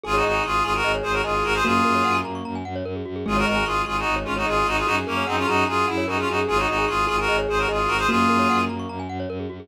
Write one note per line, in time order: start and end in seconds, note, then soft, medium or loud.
0.04 0.22 G#1 medium
0.04 0.15 F4 medium
0.04 0.13 G#4 loud
0.04 0.33 G#4 medium
0.04 0.15 G#4 loud
0.14 0.24 D#4 medium
0.14 0.24 F#4 medium
0.14 0.23 C#5 medium
0.23 0.40 G#1 medium
0.23 0.43 D#4 medium
0.23 0.43 F#4 medium
0.23 0.33 D#5 medium
0.34 0.60 G#4 medium
0.34 0.43 G#5 medium
0.44 0.62 G#1 medium
0.44 0.63 F4 medium
0.44 0.63 G#4 medium
0.44 0.53 C#6 loud
0.54 0.63 D#6 medium
0.64 0.81 G#1 medium
0.64 0.73 F4 medium
0.64 0.73 G#4 loud
0.64 0.83 G#4 medium
0.64 0.73 C#6 medium
0.74 0.92 F#4 medium
0.74 0.92 A#4 medium
0.74 0.83 G#5 medium
0.83 1.00 G#1 medium
0.83 1.21 G#4 medium
0.83 0.93 D#5 loud
0.94 1.03 C#5 loud
1.03 1.21 G#1 medium
1.03 1.12 G#4 medium
1.03 1.13 G#4 medium
1.03 1.12 C5 medium
1.12 1.22 F#4 medium
1.12 1.22 A#4 medium
1.12 1.23 C#5 medium
1.24 1.42 G#1 medium
1.24 1.44 F4 medium
1.24 1.60 G#4 medium
1.24 1.44 G#4 medium
1.24 1.33 D#5 medium
1.34 1.43 G#5 medium
1.44 1.61 G#1 medium
1.44 1.54 F#4 medium
1.44 1.54 A#4 loud
1.44 1.53 C#6 medium
1.54 1.64 G#4 loud
1.54 1.64 C5 loud
1.54 1.64 D#6 medium
1.64 1.81 F#2 medium
1.64 2.56 A#3 medium
1.64 2.17 F4 medium
1.64 1.73 F#4 loud
1.64 2.17 G#4 loud
1.75 1.84 G#4 medium
1.85 2.02 F#2 medium
1.85 1.94 A#4 loud
1.95 2.04 C#5 medium
2.05 2.22 F#2 medium
2.05 2.14 F#5 loud
2.15 2.24 G#5 medium
2.24 2.41 F#2 medium
2.24 2.34 A#5 medium
2.35 2.44 C#6 medium
2.45 2.63 F#2 medium
2.45 2.54 A#5 medium
2.55 2.64 G#5 medium
2.65 2.82 F#2 medium
2.65 2.74 F#5 medium
2.76 2.85 C#5 loud
2.85 3.02 F#2 medium
2.85 2.94 A#4 loud
2.95 3.04 G#4 medium
3.05 3.23 F#2 medium
3.05 3.15 F#4 medium
3.16 3.25 G#4 medium
3.26 3.43 G#1 medium
3.26 3.55 G#3 medium
3.26 3.37 F4 medium
3.26 3.35 G#4 loud
3.26 3.37 G#4 medium
3.36 3.46 F#4 medium
3.36 3.46 A#4 loud
3.36 3.45 C#5 medium
3.46 3.64 G#1 medium
3.46 3.65 F#4 medium
3.46 3.65 A#4 medium
3.46 3.55 D#5 medium
3.56 3.85 G#3 medium
3.56 3.65 G#5 medium
3.65 3.82 G#1 medium
3.65 3.82 F4 medium
3.65 3.82 G#4 medium
3.65 3.75 C#6 loud
3.76 3.85 D#6 medium
3.85 4.04 G#1 medium
3.85 4.05 G#3 medium
3.85 3.97 F4 medium
3.85 3.97 G#4 medium
3.85 3.95 C#6 medium
3.96 4.15 D#4 medium
3.96 4.15 F#4 medium
3.96 4.05 G#5 medium
4.06 4.24 G#1 medium
4.06 4.39 G#3 medium
4.06 4.15 D#5 medium
4.16 4.25 C#5 medium
4.24 4.44 G#1 medium
4.24 4.34 C#4 medium
4.24 4.34 F4 medium
4.24 4.35 G#4 medium
4.36 4.46 D#4 medium
4.36 4.46 F#4 medium
4.36 4.45 C#5 medium
4.46 4.63 G#1 medium
4.46 4.82 G#3 medium
4.46 4.67 F4 medium
4.46 4.67 G#4 medium
4.46 4.56 D#5 medium
4.57 4.66 G#5 loud
4.66 4.83 G#1 medium
4.66 4.77 D#4 medium
4.66 4.77 F#4 loud
4.66 4.76 C#6 loud
4.77 4.86 F4 medium
4.77 4.86 G#4 medium
4.77 4.86 D#6 medium
4.86 5.04 F#2 medium
4.86 4.95 D#4 loud
4.86 4.95 F#4 loud
4.86 4.96 F#4 loud
4.86 5.13 G#4 medium
4.97 5.06 G#4 medium
5.05 5.22 F#2 medium
5.05 5.24 A#3 medium
5.05 5.24 C#4 medium
5.05 5.16 A#4 medium
5.16 5.45 G#4 medium
5.16 5.26 C#5 medium
5.27 5.45 F#2 medium
5.27 5.36 C4 medium
5.27 5.36 D#4 medium
5.27 5.36 F#5 loud
5.37 5.47 C#4 medium
5.37 5.47 F4 medium
5.37 5.46 G#5 medium
5.47 5.64 F#2 medium
5.47 5.64 D#4 medium
5.47 5.64 F#4 medium
5.47 5.67 G#4 medium
5.47 5.56 A#5 loud
5.57 5.66 C#6 medium
5.67 5.85 F#2 medium
5.67 5.86 F4 medium
5.67 6.01 G#4 medium
5.67 5.86 G#4 medium
5.67 5.76 A#5 medium
5.77 5.86 G#5 medium
5.87 6.06 F#2 medium
5.87 6.04 E4 medium
5.87 5.97 F#5 medium
5.97 6.07 C#5 loud
6.07 6.24 F#2 medium
6.07 6.17 D#4 medium
6.07 6.17 F#4 medium
6.07 6.47 G#4 medium
6.07 6.17 A#4 loud
6.18 6.28 C#4 medium
6.18 6.28 F4 medium
6.18 6.27 G#4 medium
6.28 6.45 F#2 medium
6.28 6.39 D#4 medium
6.28 6.37 F#4 medium
6.28 6.39 F#4 medium
6.38 6.47 G#4 medium
6.48 6.66 G#1 medium
6.48 6.58 F4 medium
6.48 6.57 G#4 loud
6.48 6.58 G#4 loud
6.48 6.77 G#4 medium
6.57 6.67 D#4 medium
6.57 6.67 F#4 medium
6.57 6.67 C#5 medium
6.68 6.86 G#1 medium
6.68 6.85 D#4 medium
6.68 6.85 F#4 medium
6.68 6.77 D#5 medium
6.78 7.04 G#4 medium
6.78 6.87 G#5 medium
6.88 7.06 G#1 medium
6.88 7.06 F4 medium
6.88 7.06 G#4 medium
6.88 6.97 C#6 loud
6.98 7.07 D#6 medium
7.07 7.27 G#1 medium
7.07 7.16 F4 medium
7.07 7.16 G#4 loud
7.07 7.26 G#4 medium
7.07 7.17 C#6 medium
7.18 7.37 F#4 medium
7.18 7.37 A#4 medium
7.18 7.27 G#5 medium
7.28 7.46 G#1 medium
7.28 7.65 G#4 medium
7.28 7.37 D#5 loud
7.38 7.47 C#5 loud
7.49 7.66 G#1 medium
7.49 7.58 G#4 medium
7.49 7.59 G#4 medium
7.49 7.59 C5 medium
7.58 7.68 F#4 medium
7.58 7.68 A#4 medium
7.58 7.68 C#5 medium
7.68 7.87 G#1 medium
7.68 7.90 F4 medium
7.68 8.04 G#4 medium
7.68 7.90 G#4 medium
7.68 7.78 D#5 medium
7.79 7.88 G#5 medium
7.88 8.05 G#1 medium
7.88 7.97 F#4 medium
7.88 7.97 A#4 loud
7.88 7.98 C#6 medium
7.98 8.07 G#4 loud
7.98 8.07 C5 loud
7.98 8.08 D#6 medium
8.09 8.27 F#2 medium
8.09 8.99 A#3 medium
8.09 8.61 F4 medium
8.09 8.18 F#4 loud
8.09 8.61 G#4 loud
8.19 8.28 G#4 medium
8.29 8.47 F#2 medium
8.29 8.38 A#4 loud
8.39 8.48 C#5 medium
8.49 8.68 F#2 medium
8.49 8.58 F#5 loud
8.59 8.68 G#5 medium
8.69 8.86 F#2 medium
8.69 8.78 A#5 medium
8.79 8.88 C#6 medium
8.89 9.07 F#2 medium
8.89 8.98 A#5 medium
8.99 9.09 G#5 medium
9.09 9.26 F#2 medium
9.09 9.18 F#5 medium
9.20 9.29 C#5 loud
9.29 9.46 F#2 medium
9.29 9.39 A#4 loud
9.40 9.49 G#4 medium
9.50 9.68 F#2 medium
9.50 9.59 F#4 medium
9.60 9.68 G#4 medium